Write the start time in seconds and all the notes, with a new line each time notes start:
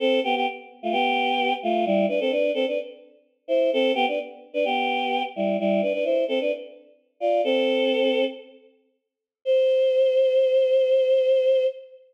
0.00 C4 A4
0.24 B3 G4
0.36 B3 G4
0.83 A3 F4
0.92 B3 G4
1.63 A3 F4
1.86 G3 E4
2.09 D4 B4
2.20 C4 A4
2.31 D4 B4
2.54 C4 A4
2.67 D4 B4
3.48 E4 C5
3.73 C4 A4
3.95 B3 G4
4.08 D4 B4
4.54 D4 B4
4.65 B3 G4
5.36 G3 E4
5.59 G3 E4
5.82 D4 B4
5.93 D4 B4
6.04 E4 C5
6.28 C4 A4
6.41 D4 B4
7.20 F4 D5
7.44 C4 A4
9.45 C5